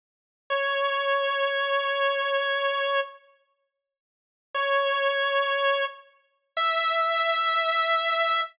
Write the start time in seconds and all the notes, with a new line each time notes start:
0.50 C#5
4.54 C#5
6.57 E5